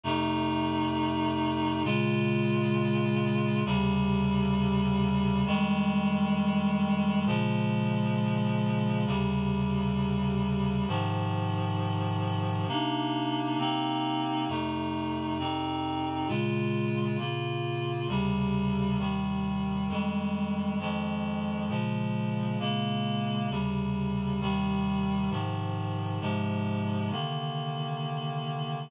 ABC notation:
X:1
M:4/4
L:1/8
Q:"Swing" 1/4=133
K:Ab
V:1 name="Clarinet"
[F,,C,=A,E]8 | [B,,D,A,F]8 | [E,,C,D,G,]8 | [F,,E,G,A,]8 |
[B,,D,F,A,]8 | [E,,C,D,G,]8 | [A,,C,E,F,]8 | [C,B,=DE]4 [C,B,CE]4 |
[F,,C,=A,E]4 [F,,C,CE]4 | [B,,D,A,F]4 [B,,D,B,F]4 | [E,,C,D,G,]4 [E,,C,E,G,]4 | [F,,E,G,A,]4 [F,,E,F,A,]4 |
[B,,D,F,A,]4 [B,,D,A,B,]4 | [E,,C,D,G,]4 [E,,C,E,G,]4 | [A,,C,E,F,]4 [A,,C,F,A,]4 | [C,=D,E,B,]8 |]